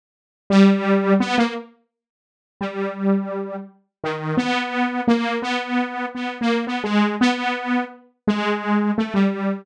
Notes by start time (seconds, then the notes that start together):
0.50 G3
1.20 B3
1.38 A#3
2.61 G3
4.04 D#3
4.37 B3
5.08 A#3
5.42 B3
6.15 B3
6.41 A#3
6.67 B3
6.84 G#3
7.21 B3
8.27 G#3
8.98 A3
9.14 G3